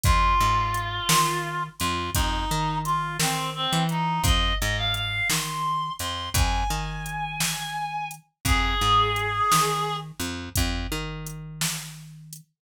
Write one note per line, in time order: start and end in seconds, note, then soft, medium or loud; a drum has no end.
0.04 0.35 F2 medium
0.04 1.63 F4 loud
0.04 kick loud
0.04 closed hi-hat loud
0.40 1.00 G#2 medium
0.74 closed hi-hat medium
1.09 1.69 D#3 medium
1.09 snare loud
1.79 2.10 F2 loud
1.79 2.11 F4 medium
1.79 closed hi-hat medium
2.14 2.45 F2 medium
2.14 2.78 D#4 medium
2.14 kick medium
2.14 closed hi-hat loud
2.51 3.18 D#3 medium
2.85 3.17 F4 medium
2.85 closed hi-hat medium
3.19 3.67 D#3 medium
3.19 3.50 C4 medium
3.19 snare loud
3.55 3.84 C4 medium
3.73 4.20 E3 loud
3.89 4.22 D#4 medium
3.89 closed hi-hat medium
4.24 4.53 F2 loud
4.24 4.55 D#5 loud
4.24 kick loud
4.24 closed hi-hat loud
4.60 5.21 G#2 loud
4.60 4.77 D#5 medium
4.78 4.95 F5 medium
4.94 5.28 F5 medium
4.94 closed hi-hat medium
5.30 5.90 D#3 medium
5.30 5.93 C6 medium
5.30 snare loud
5.99 6.30 F2 medium
5.99 6.29 C6 medium
5.99 closed hi-hat medium
6.34 6.64 F2 loud
6.34 8.08 G#5 medium
6.34 kick medium
6.34 closed hi-hat loud
6.70 8.19 D#3 medium
7.06 closed hi-hat medium
7.40 snare loud
8.11 closed hi-hat medium
8.45 8.75 F2 loud
8.45 9.96 G#4 loud
8.45 kick medium
8.45 closed hi-hat medium
8.81 9.41 G#2 medium
9.16 closed hi-hat medium
9.52 10.12 D#3 medium
9.52 snare loud
10.20 10.49 F2 medium
10.20 closed hi-hat medium
10.56 10.87 F2 loud
10.56 kick medium
10.56 closed hi-hat loud
10.92 12.41 D#3 medium
11.27 closed hi-hat medium
11.61 snare loud
12.33 closed hi-hat medium